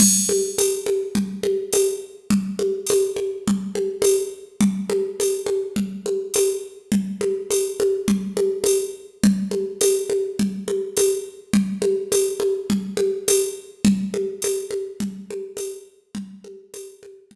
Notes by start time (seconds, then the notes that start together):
0.00 crash, low conga
0.29 high conga
0.58 tambourine, high conga
0.86 high conga
1.15 low conga
1.43 high conga
1.73 tambourine, high conga
2.30 low conga
2.59 high conga
2.87 tambourine, high conga
3.16 high conga
3.47 low conga
3.75 high conga
4.02 tambourine, high conga
4.61 low conga
4.90 high conga
5.20 tambourine, high conga
5.46 high conga
5.76 low conga
6.06 high conga
6.34 tambourine, high conga
6.92 low conga
7.21 high conga
7.50 tambourine, high conga
7.80 high conga
8.08 low conga
8.37 high conga
8.64 tambourine, high conga
9.24 low conga
9.51 high conga
9.81 tambourine, high conga
10.10 high conga
10.39 low conga
10.68 high conga
10.97 tambourine, high conga
11.53 low conga
11.82 high conga
12.12 tambourine, high conga
12.40 high conga
12.70 low conga
12.97 high conga
13.28 tambourine, high conga
13.85 low conga
14.14 high conga
14.42 tambourine, high conga
14.71 high conga
15.00 low conga
15.31 high conga
15.57 tambourine, high conga
16.15 low conga
16.44 high conga
16.74 tambourine, high conga
17.03 high conga
17.31 low conga